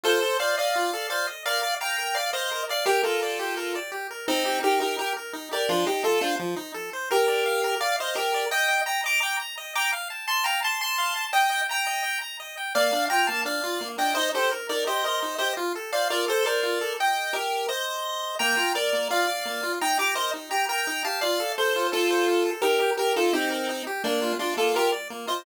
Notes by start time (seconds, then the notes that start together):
0.03 F4 A4 C5
0.22 A4
0.40 C5 D5 F5
0.57 D5 D#5 F5
0.76 F4
0.93 A4
1.10 C5 D5 F5
1.27 D#5
1.46 A#4 D5 F5
1.63 D5
1.80 F5 G5 A#5
1.98 A#4
2.15 D5 F5
2.33 C5 D#5 F5
2.51 A#4
2.69 D5 F5
2.86 G4 A#4
3.03 F4 A4 A#4
3.22 D5
3.39 G4
3.57 A#4
3.75 D5
3.92 G4
4.11 A#4
4.28 C4 D#4
4.45 G4
4.63 D#4 G4 A#4
4.80 D#4 G4 A#4
4.99 G4 A#4
5.17 A#4
5.33 D#4
5.51 G4 A#4 D5
5.69 F3 D4 F4
5.86 D#4 G4
6.04 F4 A4
6.21 D4 F4 C5
6.39 F3
6.56 D#4
6.74 A4
6.93 C5
7.11 G4 A#4
7.28 D5
7.46 F5
7.64 A#4
7.80 D5 F5
7.99 C5 D#5 F5
8.15 G4 A#4
8.34 D5
8.51 D#5 G5
8.68 G5
8.86 G5 A#5
9.04 D#5 A#5 D6
9.20 G5 A#5 D6
9.40 A#5
9.58 D#5
9.75 G5 A#5 D6
9.92 F5
10.10 A5
10.27 A5 C6
10.44 F5 G5 A#5
10.62 A5 C6
10.81 A5 C6
10.98 F5
11.16 A5
11.33 D#5 G5
11.51 G5
11.69 G5 A#5
11.87 D#5
12.04 G5
12.21 A#5
12.40 D#5
12.57 G5
12.75 A#3 D5 F5
12.92 D4
13.10 F4 G5 A#5
13.27 A#3 F5 A5
13.45 D4 D5 F5
13.63 F4
13.81 A#3
13.98 D4 D#5 G5
14.15 D#4 C5 D#5
14.34 G4 A4 C5
14.51 A#4
14.69 D#4 A#4 D5
14.87 G4 C5 D#5
15.04 A#4 C5 D#5
15.22 D#4
15.38 G4 C5 D#5
15.57 F4
15.75 A4
15.92 C5 D5 F5
16.10 F4 A#4 D5
16.28 A4 C5
16.45 A#4 C5 D5
16.63 F4
16.81 A4
17.00 D#5 G5
17.33 G4 A#4
17.69 C5 D#5
18.39 A#3 G5 A#5
18.57 F4
18.75 A#4 D5
18.93 A#3
19.10 F4 D5 F5
19.27 D5
19.45 A#3
19.63 F4
19.81 D#4 G5 A#5
19.99 G4 A#5 D6
20.15 A#4 C5 D#5
20.34 D#4
20.51 G4 G5 A#5
20.69 A#4 G5 A#5
20.87 D#4
21.04 G4 F5 A5
21.21 F4 D5 F5
21.40 A4
21.58 A4 C5
21.76 F4
21.92 F4 A4
22.11 C5
22.28 F4
22.45 A4
22.62 D#4 G4 A#4
22.80 G4
22.97 G4 A#4
23.16 D#4 F4 A4
23.33 C4 D#4 G4
23.51 A#4
23.69 D#4
23.87 G4
24.04 A#3 D4
24.22 F4
24.39 D4 F4 D5
24.57 A#3 F4 A4
24.75 F4 G4 A#4
24.92 D5
25.10 A#3
25.27 F4 C5 D#5